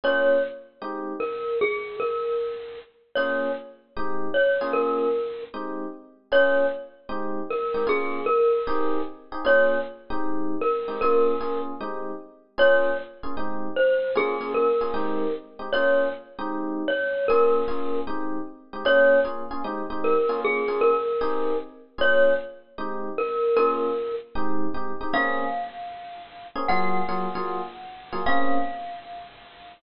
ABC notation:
X:1
M:4/4
L:1/8
Q:"Swing" 1/4=153
K:Bbm
V:1 name="Glockenspiel"
d2 z4 B2 | A2 B4 z2 | d2 z4 d2 | B4 z4 |
d2 z4 B2 | A2 B4 z2 | d2 z4 B2 | B3 z5 |
d2 z4 c2 | A2 B4 z2 | d2 z4 d2 | B4 z4 |
d2 z4 B2 | A2 B4 z2 | d2 z4 B2 | B3 z5 |
f8 | g8 | f8 |]
V:2 name="Electric Piano 1"
[B,DFA]4 [A,CE=G]4 | z8 | [B,DFA]4 [A,CE=G]3 [B,DFA]- | [B,DFA]4 [A,CE=G]4 |
[B,DFA]4 [A,CE=G]3 [A,CEG] | [B,DFA]4 [CE=GA]3 [CEGA] | [B,DFA]3 [A,CE=G]4 [A,CEG] | [B,DFA]2 [B,DFA]2 [A,CE=G]4 |
[B,DFA]3 [B,DFA] [A,CE=G]4 | [B,DFA] [B,DFA]2 [B,DFA] [A,CE=G]3 [A,CEG] | [B,DFA]3 [A,CE=G]5 | [B,DFA]2 [B,DFA]2 [A,CE=G]3 [A,CEG] |
[B,DFA]2 [B,DFA] [B,DFA] [A,CE=G] [A,CEG]2 [B,DFA]- | [B,DFA] [B,DFA]3 [CE=GA]4 | [B,DFA]4 [A,CE=G]4 | [B,DFA]4 [A,CE=G]2 [A,CEG] [A,CEG] |
[B,CDA]7 [B,CDA] | [G,B,FA]2 [G,B,FA] [G,B,FA]4 [G,B,FA] | [B,CDA]8 |]